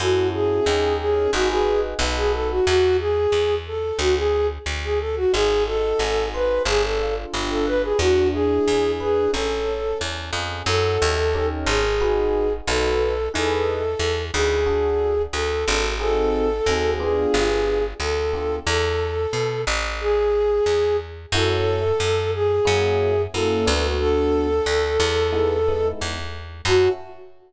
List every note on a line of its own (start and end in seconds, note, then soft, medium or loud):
0.00 0.60 F#2 medium
0.00 0.61 C#4 loud
0.00 0.61 E4 loud
0.00 0.28 F#4 medium
0.00 0.61 F#4 medium
0.00 0.61 A4 loud
0.33 0.95 G#4 medium
0.66 1.28 D#2 medium
0.66 1.27 C#4 loud
0.66 1.27 D#4 loud
0.66 1.27 G4 loud
0.66 1.27 A#4 loud
1.00 1.31 G#4 medium
1.33 1.94 G#1 medium
1.33 1.94 D#4 loud
1.33 1.49 F#4 medium
1.33 1.94 F#4 loud
1.33 1.94 G#4 loud
1.33 1.94 B4 loud
1.50 1.81 G#4 medium
1.99 2.60 B1 loud
1.99 2.61 D#4 loud
1.99 2.61 F#4 loud
1.99 2.61 A4 loud
1.99 2.61 B4 loud
2.16 2.32 G#4 medium
2.33 2.49 A4 medium
2.50 2.66 F#4 medium
2.66 3.27 E2 loud
2.66 2.97 F#4 medium
2.99 3.55 G#4 medium
3.32 3.92 E2 medium
3.67 3.98 A4 medium
3.99 4.59 D2 loud
3.99 4.15 F#4 medium
4.16 4.47 G#4 medium
4.66 5.26 D2 medium
4.84 4.99 G#4 medium
5.00 5.15 A4 medium
5.16 5.32 F#4 medium
5.33 5.94 G#1 medium
5.33 6.60 D#4 loud
5.33 5.64 G#4 medium
5.66 6.62 F#4 medium
5.66 6.26 A4 medium
5.99 6.59 G#1 medium
5.99 6.63 G#4 medium
6.34 6.63 B4 medium
6.34 6.66 C5 medium
6.65 7.25 G1 loud
6.65 7.93 D4 loud
6.65 6.83 G#4 medium
6.83 7.15 A4 medium
6.99 7.94 F4 medium
7.33 7.94 G1 medium
7.33 7.97 G4 medium
7.50 7.66 A4 medium
7.67 7.82 B4 medium
7.67 7.98 B4 medium
7.83 7.99 G#4 medium
7.99 8.59 E2 loud
7.99 9.27 D4 loud
7.99 8.28 F#4 medium
8.33 9.28 E4 medium
8.33 8.92 G#4 medium
8.68 9.28 E2 medium
8.68 9.31 G#4 medium
9.00 9.31 G#4 medium
9.00 9.32 B4 medium
9.33 9.94 A1 medium
9.33 9.99 C#4 loud
9.33 9.98 A4 medium
9.66 10.61 A4 medium
10.00 10.31 E2 medium
10.00 10.63 C#4 medium
10.33 10.63 F2 medium
10.33 10.65 G#4 medium
10.66 10.98 F#2 loud
10.66 11.13 C#4 medium
10.66 11.13 E4 medium
10.66 11.13 F#4 loud
10.66 11.13 A4 loud
10.66 11.47 A4 medium
11.02 11.65 D#2 loud
11.34 11.81 C#4 loud
11.34 11.81 D#4 medium
11.34 11.81 G4 loud
11.34 11.81 A#4 loud
11.66 12.61 G#1 loud
11.66 12.53 G#4 medium
12.01 12.47 D#4 loud
12.01 12.47 F#4 loud
12.01 12.47 G#4 medium
12.01 12.47 B4 loud
12.67 13.29 B1 loud
12.67 13.14 D#4 loud
12.67 13.14 F#4 loud
12.67 13.29 A4 medium
12.67 13.14 A4 loud
12.67 13.14 B4 loud
13.34 13.95 E2 medium
13.34 13.81 D#4 loud
13.34 13.81 E4 medium
13.34 13.81 G#4 loud
13.34 14.22 A4 medium
13.34 13.81 B4 loud
13.99 14.31 E2 medium
14.33 15.27 D2 loud
14.33 14.57 D#4 medium
14.33 14.57 E4 medium
14.33 15.23 G#4 medium
14.33 14.57 G#4 medium
14.33 14.57 B4 medium
14.66 15.13 D4 medium
14.66 15.13 F#4 loud
14.66 15.13 A4 loud
15.33 15.65 D2 medium
15.33 15.91 A4 medium
15.68 16.61 G#1 loud
15.68 15.92 D4 medium
15.68 15.92 F#4 medium
15.68 15.92 A4 medium
16.00 16.47 C4 loud
16.00 16.47 D#4 loud
16.00 16.47 F#4 medium
16.00 16.47 G#4 loud
16.00 16.91 A4 medium
16.66 17.26 D#2 medium
16.66 16.99 C4 medium
16.66 16.99 D#4 medium
16.66 16.99 F#4 medium
16.66 16.99 G#4 medium
17.00 17.80 B3 loud
17.00 17.80 D4 medium
17.00 17.80 F4 loud
17.00 17.80 G4 loud
17.00 17.84 G#4 medium
17.34 17.94 G1 loud
18.00 18.60 D2 medium
18.00 18.56 A4 medium
18.33 18.57 B3 medium
18.33 18.57 D4 medium
18.33 18.57 F4 medium
18.33 18.57 G4 medium
18.67 19.27 E2 loud
18.67 19.61 A4 medium
19.33 19.65 B2 medium
19.67 20.60 A1 loud
20.00 20.97 G#4 medium
20.66 21.26 E2 medium
21.32 21.92 F#2 loud
21.32 21.80 A3 loud
21.32 21.80 C#4 loud
21.32 21.80 E4 loud
21.32 21.80 F#4 loud
21.32 22.31 A4 medium
22.00 22.60 F#2 loud
22.34 23.22 G#4 medium
22.65 23.27 F#2 loud
22.65 23.12 A#3 loud
22.65 23.12 C#4 loud
22.65 23.12 E4 loud
22.65 23.12 F#4 loud
23.34 23.66 F#2 medium
23.34 23.66 A#3 loud
23.34 23.66 C#4 medium
23.34 23.66 E4 loud
23.34 23.66 F#4 medium
23.34 23.87 A4 medium
23.66 24.61 D2 loud
23.66 24.46 A3 loud
23.66 24.46 B3 loud
23.66 24.46 D4 loud
23.66 24.46 F#4 loud
24.00 25.88 A4 medium
24.66 24.98 D2 medium
25.00 25.93 E2 loud
25.32 25.56 G#3 loud
25.32 25.56 B3 loud
25.32 25.56 D#4 loud
25.32 25.56 E4 loud
25.68 26.15 G#3 loud
25.68 26.15 B3 medium
25.68 26.15 D#4 medium
25.68 26.15 E4 medium
26.01 26.61 E2 medium
26.65 26.88 F#2 loud
26.65 26.91 C#4 loud
26.65 26.91 E4 loud
26.65 26.90 F#4 loud
26.65 26.91 F#4 loud
26.65 26.91 A4 loud